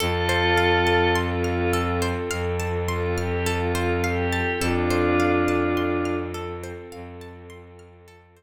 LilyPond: <<
  \new Staff \with { instrumentName = "Pad 5 (bowed)" } { \time 4/4 \key f \major \tempo 4 = 52 <f' a'>4 f'8 f'16 r8. f'16 g'16 f'8 g'8 | <d' f'>4. r2 r8 | }
  \new Staff \with { instrumentName = "Orchestral Harp" } { \time 4/4 \key f \major a'16 c''16 f''16 a''16 c'''16 f'''16 a'16 c''16 f''16 a''16 c'''16 f'''16 a'16 c''16 f''16 a''16 | a'16 c''16 f''16 a''16 c'''16 f'''16 a'16 c''16 f''16 a''16 c'''16 f'''16 a'16 c''16 r8 | }
  \new Staff \with { instrumentName = "Pad 2 (warm)" } { \time 4/4 \key f \major <c' f' a'>1 | <c' f' a'>1 | }
  \new Staff \with { instrumentName = "Violin" } { \clef bass \time 4/4 \key f \major f,2 f,2 | f,2 f,2 | }
>>